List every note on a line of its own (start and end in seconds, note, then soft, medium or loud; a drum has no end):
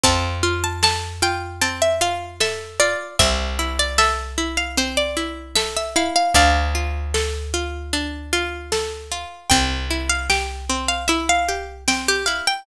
0.03 2.95 F2 medium
0.03 1.61 C4 medium
0.03 0.61 A5 loud
0.03 kick loud
0.03 closed hi-hat loud
0.43 1.22 F4 medium
0.64 0.82 A5 medium
0.83 2.40 A4 medium
0.83 1.22 A5 loud
0.83 snare loud
1.22 2.00 F4 medium
1.22 1.60 G5 loud
1.61 3.12 C4 medium
1.61 1.80 A5 medium
1.61 closed hi-hat loud
1.82 2.00 E5 medium
2.01 2.79 F4 medium
2.01 2.36 F5 medium
2.40 3.15 A4 medium
2.40 2.79 E5 loud
2.40 snare loud
2.80 3.17 F4 medium
2.80 3.16 D5 loud
3.19 6.10 C2 medium
3.19 4.77 C4 medium
3.19 3.69 E5 loud
3.19 kick loud
3.19 closed hi-hat loud
3.59 4.37 E4 medium
3.79 3.98 D5 loud
3.98 5.56 A4 medium
3.98 4.51 E5 loud
3.98 snare loud
4.38 5.16 E4 medium
4.57 4.76 F5 medium
4.77 6.27 C4 medium
4.77 4.97 C5 loud
4.77 closed hi-hat loud
4.97 5.52 D5 loud
5.17 5.95 E4 medium
5.55 6.31 A4 medium
5.55 5.74 E5 loud
5.55 snare loud
5.76 5.95 E5 medium
5.96 6.33 E4 medium
5.96 6.15 F5 loud
6.16 6.34 F5 loud
6.34 9.25 D2 loud
6.34 7.92 D4 medium
6.34 8.14 D5 loud
6.34 8.14 F5 loud
6.34 kick loud
6.34 closed hi-hat loud
6.75 7.53 F4 medium
7.14 8.71 A4 medium
7.14 snare loud
7.54 8.32 F4 medium
7.93 9.43 D4 medium
7.93 closed hi-hat loud
8.33 9.11 F4 medium
8.72 9.47 A4 medium
8.72 snare loud
9.12 9.49 F4 medium
9.50 12.41 C2 medium
9.50 9.87 C4 medium
9.50 10.07 G5 loud
9.50 kick loud
9.50 closed hi-hat loud
9.90 10.26 E4 medium
10.09 10.28 F5 loud
10.30 10.65 G4 medium
10.30 10.87 G5 medium
10.30 snare loud
10.69 11.05 C4 medium
10.88 11.07 F5 medium
11.08 11.44 E4 medium
11.08 11.26 E5 medium
11.08 closed hi-hat loud
11.29 11.77 F5 loud
11.49 11.84 G4 medium
11.88 12.23 C4 medium
11.88 12.07 G5 loud
11.88 snare loud
12.08 12.27 G4 loud
12.26 12.63 E4 medium
12.26 12.45 F5 medium
12.47 12.66 G5 loud